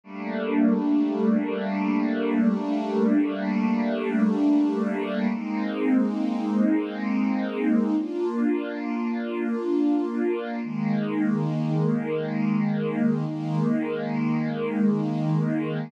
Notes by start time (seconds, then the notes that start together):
0.04 G3 A3 A#3 D4
5.33 G#3 A#3 C4 D#4
7.98 A#3 D4 F4
10.63 D#3 G#3 A#3
13.27 D#3 G#3 A#3